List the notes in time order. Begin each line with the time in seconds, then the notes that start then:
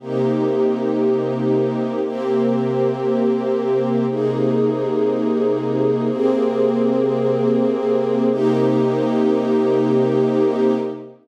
0.00 C3 A#3 D#4 G4
2.03 C3 A#3 C4 G4
4.07 C3 A#3 D#4 G#4
6.09 C3 A#3 C4 G#4
8.30 C3 A#3 D#4 G4